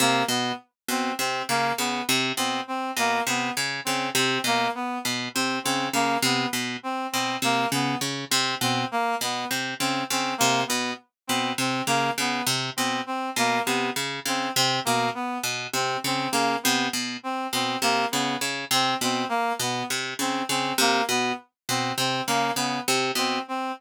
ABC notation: X:1
M:4/4
L:1/8
Q:1/4=101
K:none
V:1 name="Orchestral Harp" clef=bass
C, B,, z B,, C, _D, D, C, | B,, z B,, C, _D, D, C, B,, | z B,, C, _D, D, C, B,, z | B,, C, _D, D, C, B,, z B,, |
C, _D, D, C, B,, z B,, C, | _D, D, C, B,, z B,, C, D, | _D, C, B,, z B,, C, D, D, | C, B,, z B,, C, _D, D, C, |
B,, z B,, C, _D, D, C, B,, | z B,, C, _D, D, C, B,, z |]
V:2 name="Clarinet"
_B, =B, z C C _B, =B, z | C C _B, =B, z C C _B, | B, z C C _B, =B, z C | C _B, =B, z C C _B, =B, |
z C C _B, =B, z C C | _B, =B, z C C _B, =B, z | C C _B, =B, z C C _B, | B, z C C _B, =B, z C |
C _B, =B, z C C _B, =B, | z C C _B, =B, z C C |]